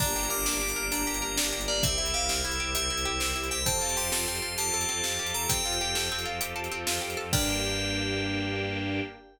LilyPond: <<
  \new Staff \with { instrumentName = "Tubular Bells" } { \time 12/8 \key g \minor \tempo 4. = 131 bes''4 d'''8 d'''4. bes''2~ bes''8 d''8 | e''4 f''8 e''4. e''2~ e''8 g''8 | a''4 c'''8 c'''4. a''2~ a''8 bes''8 | g''2~ g''8 r2. r8 |
g''1. | }
  \new Staff \with { instrumentName = "Orchestral Harp" } { \time 12/8 \key g \minor d'8 g'8 bes'8 d'8 g'8 bes'8 d'8 g'8 bes'8 d'8 g'8 bes'8 | c'8 e'8 g'8 c'8 e'8 g'8 c'8 e'8 g'8 c'8 e'8 g'8 | c'8 f'8 g'8 a'8 c'8 f'8 g'8 a'8 c'8 f'8 g'8 a'8 | c'8 f'8 g'8 a'8 c'8 f'8 g'8 a'8 c'8 f'8 g'8 a'8 |
<d' g' bes'>1. | }
  \new Staff \with { instrumentName = "Violin" } { \clef bass \time 12/8 \key g \minor g,,8 g,,8 g,,8 g,,8 g,,8 g,,8 g,,8 g,,8 g,,8 g,,8 g,,8 g,,8 | c,8 c,8 c,8 c,8 c,8 c,8 c,8 c,8 c,8 c,8 c,8 c,8 | f,8 f,8 f,8 f,8 f,8 f,8 f,8 f,8 f,8 f,8 f,8 f,8 | f,8 f,8 f,8 f,8 f,8 f,8 f,8 f,8 f,8 f,8 f,8 f,8 |
g,1. | }
  \new Staff \with { instrumentName = "String Ensemble 1" } { \time 12/8 \key g \minor <bes d' g'>1. | <c' e' g'>1. | <c' f' g' a'>1.~ | <c' f' g' a'>1. |
<bes d' g'>1. | }
  \new DrumStaff \with { instrumentName = "Drums" } \drummode { \time 12/8 <cymc bd>8. hh8. sn8. hh8. hh8. hh8. sn8. hh8. | <hh bd>8. hh8. sn8. hh8. hh8. hh8. sn8. hh8. | <hh bd>8. hh8. sn8. hh8. hh8. hh8. sn8. hh8. | <hh bd>8. hh8. sn8. hh8. hh8. hh8. sn8. hh8. |
<cymc bd>4. r4. r4. r4. | }
>>